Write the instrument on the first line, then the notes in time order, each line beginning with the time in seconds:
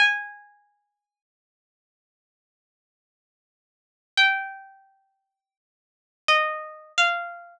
pizzicato strings
0.00 G#5
4.17 G5
6.28 D#5
6.98 F5